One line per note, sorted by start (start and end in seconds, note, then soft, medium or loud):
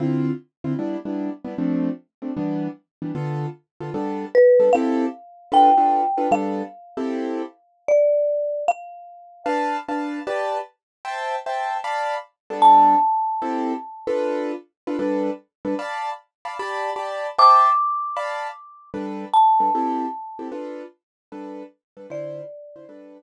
0.00 0.31 D3 medium
0.00 0.31 C4 medium
0.00 0.31 E4 medium
0.00 0.31 F4 medium
0.64 0.74 D3 medium
0.64 0.74 C4 medium
0.64 0.74 E4 medium
0.64 0.74 F4 medium
0.79 0.97 G3 medium
0.79 0.97 B3 medium
0.79 0.97 D4 medium
0.79 0.97 E4 medium
1.05 1.30 G3 medium
1.05 1.30 B3 medium
1.05 1.30 D4 medium
1.05 1.30 E4 medium
1.44 1.54 G3 medium
1.44 1.54 B3 medium
1.44 1.54 D4 medium
1.44 1.54 E4 medium
1.58 1.89 F3 medium
1.58 1.89 A3 medium
1.58 1.89 C4 medium
1.58 1.89 D4 medium
2.22 2.32 F3 medium
2.22 2.32 A3 medium
2.22 2.32 C4 soft
2.22 2.32 D4 medium
2.37 2.68 E3 medium
2.37 2.68 G3 medium
2.37 2.68 B3 medium
2.37 2.68 D4 medium
3.02 3.12 E3 medium
3.02 3.12 G3 medium
3.02 3.12 B3 medium
3.02 3.12 D4 medium
3.15 3.46 D3 medium
3.15 3.46 B3 medium
3.15 3.46 F4 medium
3.15 3.46 A4 medium
3.81 3.90 D3 medium
3.81 3.90 B3 medium
3.81 3.90 F4 medium
3.81 3.90 A4 medium
3.94 4.25 G3 medium
3.94 4.25 B3 medium
3.94 4.25 D4 medium
3.94 4.25 A4 medium
4.35 4.73 B4 medium
4.60 4.69 G3 medium
4.60 4.69 B3 medium
4.60 4.69 D4 medium
4.60 4.69 A4 medium
4.73 5.06 C4 medium
4.73 5.06 E4 medium
4.73 5.06 G4 medium
4.73 5.06 A4 medium
4.73 5.52 F5 medium
5.52 5.70 D4 medium
5.52 5.70 F4 medium
5.52 5.70 A4 medium
5.52 5.70 B4 medium
5.52 6.32 G5 soft
5.77 6.02 D4 medium
5.77 6.02 F4 medium
5.77 6.02 A4 medium
5.77 6.02 B4 medium
6.18 6.27 D4 medium
6.18 6.27 F4 medium
6.18 6.27 A4 medium
6.18 6.27 B4 medium
6.31 6.62 G3 medium
6.31 6.62 B3 medium
6.31 6.62 D4 medium
6.31 6.62 A4 medium
6.31 7.88 F5 medium
6.97 7.42 C4 medium
6.97 7.42 E4 medium
6.97 7.42 G4 medium
6.97 7.42 A4 medium
7.88 8.64 D5 soft
8.68 9.44 F5 medium
9.46 9.77 D4 medium
9.46 9.77 B4 medium
9.46 9.77 F5 medium
9.46 9.77 A5 medium
9.88 10.20 D4 medium
9.88 10.20 B4 medium
9.88 10.20 F5 medium
9.88 10.20 A5 medium
10.27 10.58 G4 medium
10.27 10.58 B4 medium
10.27 10.58 D5 medium
10.27 10.58 A5 medium
11.05 11.36 C5 medium
11.05 11.36 E5 medium
11.05 11.36 G5 medium
11.05 11.36 A5 medium
11.46 11.77 C5 medium
11.46 11.77 E5 medium
11.46 11.77 G5 medium
11.46 11.77 A5 medium
11.84 12.15 D5 medium
11.84 12.15 F5 medium
11.84 12.15 A5 medium
11.84 12.15 B5 medium
12.50 12.95 G3 medium
12.50 12.95 B3 medium
12.50 12.95 D4 medium
12.50 12.95 A4 medium
12.62 14.09 A5 medium
13.42 13.73 C4 medium
13.42 13.73 E4 medium
13.42 13.73 G4 medium
13.42 13.73 A4 medium
14.07 14.52 D4 medium
14.07 14.52 F4 medium
14.07 14.52 A4 medium
14.07 14.52 B4 medium
14.87 14.97 D4 medium
14.87 14.97 F4 medium
14.87 14.97 A4 medium
14.87 14.97 B4 medium
14.99 15.30 G3 medium
14.99 15.30 D4 medium
14.99 15.30 A4 medium
14.99 15.30 B4 medium
15.65 15.75 G3 medium
15.65 15.75 D4 medium
15.65 15.75 A4 medium
15.65 15.75 B4 medium
15.79 16.10 D5 medium
15.79 16.10 F5 medium
15.79 16.10 A5 medium
15.79 16.10 B5 medium
16.45 16.55 D5 medium
16.45 16.55 F5 medium
16.45 16.55 A5 medium
16.45 16.55 B5 medium
16.59 16.90 G4 medium
16.59 16.90 D5 medium
16.59 16.90 A5 medium
16.59 16.90 B5 medium
16.96 17.27 G4 medium
16.96 17.27 D5 medium
16.96 17.27 A5 medium
16.96 17.27 B5 medium
17.38 17.70 C5 medium
17.38 17.70 E5 medium
17.38 17.70 G5 medium
17.38 17.70 A5 medium
17.38 18.87 D6 medium
18.17 18.48 D5 medium
18.17 18.48 F5 medium
18.17 18.48 A5 medium
18.17 18.48 B5 medium
18.94 19.25 G3 medium
18.94 19.25 D4 medium
18.94 19.25 A4 medium
18.94 19.25 B4 medium
19.34 20.48 A5 medium
19.60 19.70 G3 medium
19.60 19.70 D4 medium
19.60 19.70 A4 medium
19.60 19.70 B4 medium
19.75 20.06 C4 medium
19.75 20.06 E4 medium
19.75 20.06 G4 medium
19.75 20.06 A4 medium
20.39 20.49 C4 medium
20.39 20.49 E4 medium
20.39 20.49 G4 medium
20.39 20.49 A4 medium
20.52 20.83 D4 medium
20.52 20.83 F4 medium
20.52 20.83 A4 medium
20.52 20.83 B4 medium
21.32 21.63 G3 medium
21.32 21.63 D4 medium
21.32 21.63 A4 medium
21.32 21.63 B4 medium
21.97 22.06 G3 medium
21.97 22.06 D4 medium
21.97 22.06 A4 medium
21.97 22.06 B4 medium
22.10 22.41 D3 medium
22.10 22.41 E4 medium
22.10 22.41 F4 medium
22.10 22.41 C5 medium
22.10 23.22 D5 medium
22.76 22.86 D3 medium
22.76 22.86 E4 medium
22.76 22.86 F4 medium
22.76 22.86 C5 medium
22.89 23.20 G3 medium
22.89 23.20 D4 medium
22.89 23.20 A4 medium
22.89 23.20 B4 medium